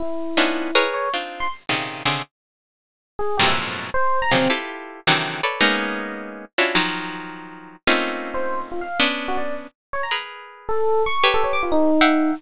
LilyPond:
<<
  \new Staff \with { instrumentName = "Orchestral Harp" } { \time 6/8 \tempo 4. = 107 r4 <b cis' d' dis' e' f'>4 <gis' ais' b' cis''>4 | <c' d' dis' f'>4 r8 <ais, c cis dis>4 <c cis d>8 | r2. | <f, fis, gis, a, ais, b,>4. r4 <ais, c cis dis f fis>8 |
<e' f' g' a' b'>4. <c d dis e fis>4 <a' b' cis'' d''>8 | <gis ais b cis' dis'>2~ <gis ais b cis' dis'>8 <cis' d' e' f' fis'>8 | <dis f fis>2. | <a ais c' cis' dis' f'>2. |
<b cis' d'>2 r4 | <gis' ais' b'>2 r4 | <g' a' b' cis''>2 <e'' f'' fis'' g''>4 | }
  \new Staff \with { instrumentName = "Electric Piano 1" } { \time 6/8 e'2~ e'8 cis''8 | r8. c'''16 r2 | r2 r8 gis'8 | g'16 e''16 r4 c''8. ais''16 c'8 |
r2. | r2. | r2. | r4 r16 c''8. r16 f'16 f''8 |
r8. fis'16 d''8 r4 cis''16 ais''16 | r4. a'4 cis'''8 | r16 a'16 cis''16 d'''16 f'16 dis'4.~ dis'16 | }
>>